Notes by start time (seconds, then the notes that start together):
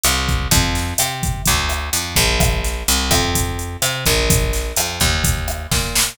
0.04 C2, cross-stick, closed hi-hat
0.29 kick, closed hi-hat
0.51 F2, kick, closed hi-hat
0.75 snare, closed hi-hat
0.98 C3, cross-stick, closed hi-hat
1.23 kick, closed hi-hat
1.45 D2, kick, closed hi-hat
1.69 cross-stick, closed hi-hat
1.93 F2, closed hi-hat
2.16 A#1, kick, closed hi-hat
2.40 kick, cross-stick, closed hi-hat
2.64 snare, closed hi-hat
2.88 C2, closed hi-hat
3.11 F2, kick, cross-stick, closed hi-hat
3.35 kick, closed hi-hat
3.59 closed hi-hat
3.82 C3, cross-stick, closed hi-hat
4.06 A#1, kick, closed hi-hat
4.30 kick, closed hi-hat
4.53 snare, closed hi-hat
4.76 F2, cross-stick, closed hi-hat
5.00 D#2, kick, closed hi-hat
5.24 kick, closed hi-hat
5.48 cross-stick, closed hi-hat
5.71 A#2, kick, snare
5.95 snare